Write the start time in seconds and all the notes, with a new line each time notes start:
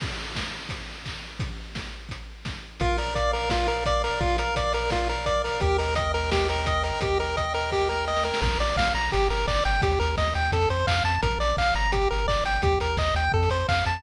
0.00 kick, crash
0.36 kick, snare
0.69 kick, closed hi-hat
1.06 kick, clap
1.39 kick, closed hi-hat
1.75 kick, snare
2.09 kick, closed hi-hat
2.45 kick, snare
2.80 A#1 F4 A#4, kick, closed hi-hat
2.98 A#4 D5, open hi-hat
3.15 D5 F5, kick, closed hi-hat
3.33 A#4 D5, open hi-hat
3.50 F4 A#4, kick, snare
3.67 A#4 D5, open hi-hat
3.86 D5 F5, kick, closed hi-hat
4.04 A#4 D5, open hi-hat
4.21 A#1 F4 A#4, kick
4.38 A#4 D5, closed hi-hat
4.56 D5 F5, kick, closed hi-hat
4.73 A#4 D5, open hi-hat
4.90 F4 A#4, kick, snare
5.09 A#4 D5, open hi-hat
5.26 D5 F5, kick, closed hi-hat
5.44 A#4 D5, open hi-hat
5.60 D#2 G4 A#4, kick, closed hi-hat
5.78 A#4 D#5, open hi-hat
5.95 D#5 G5, kick, closed hi-hat
6.14 A#4 D#5, open hi-hat
6.32 G4 A#4, kick, snare
6.48 A#4 D#5, open hi-hat
6.66 D#5 G5, kick, closed hi-hat
6.83 A#4 D#5, open hi-hat
7.01 D#2 G4 A#4, kick, closed hi-hat
7.19 A#4 D#5, open hi-hat
7.37 D#5 G5, kick, closed hi-hat
7.54 A#4 D#5, open hi-hat
7.72 G4 A#4, kick, snare
7.89 A#4 D#5, snare
8.07 D#5 G5, snare
8.16 snare
8.23 A#4 D#5, snare
8.34 snare
8.42 A#1 A#4, kick, crash
8.50 closed hi-hat
8.59 A#1 D5, open hi-hat
8.69 closed hi-hat
8.76 A#1 F5, kick, snare
8.86 closed hi-hat
8.95 A#1 A#5, open hi-hat
9.03 closed hi-hat
9.12 G1 G4, kick, closed hi-hat
9.30 G1 A#4, open hi-hat
9.39 closed hi-hat
9.47 G1 D5, kick, clap
9.56 closed hi-hat
9.64 G1 G5, open hi-hat
9.74 closed hi-hat
9.82 D#2 G4, kick, closed hi-hat
9.91 closed hi-hat
10.00 D#2 A#4, open hi-hat
10.09 closed hi-hat
10.17 D#2 D#5, kick, snare
10.27 closed hi-hat
10.34 D#2 G5, open hi-hat
10.45 closed hi-hat
10.52 F2 A4, kick, closed hi-hat
10.62 closed hi-hat
10.69 F2 C5, open hi-hat
10.79 closed hi-hat
10.87 F2 F5, kick, clap
10.96 closed hi-hat
11.04 F2 A5, open hi-hat
11.14 closed hi-hat
11.23 A#1 A#4, kick, closed hi-hat
11.31 closed hi-hat
11.39 A#1 D5, open hi-hat
11.49 closed hi-hat
11.57 A#1 F5, kick, clap
11.66 closed hi-hat
11.74 G1 A#5, open hi-hat
11.85 closed hi-hat
11.92 G4, kick, closed hi-hat
12.01 closed hi-hat
12.11 G1 A#4, open hi-hat
12.18 closed hi-hat
12.27 G1 D5, kick, clap
12.37 closed hi-hat
12.44 G1 G5, open hi-hat
12.55 closed hi-hat
12.62 D#2 G4, kick, closed hi-hat
12.72 closed hi-hat
12.80 D#2 A#4, open hi-hat
12.89 closed hi-hat
12.97 D#2 D#5, kick, clap
13.06 closed hi-hat
13.15 D#2 G5, open hi-hat
13.23 closed hi-hat
13.32 F2 A4, kick
13.43 closed hi-hat
13.50 F2 C5, open hi-hat
13.60 closed hi-hat
13.68 F2 F5, kick, clap
13.79 closed hi-hat
13.85 F2 A5, open hi-hat
13.96 closed hi-hat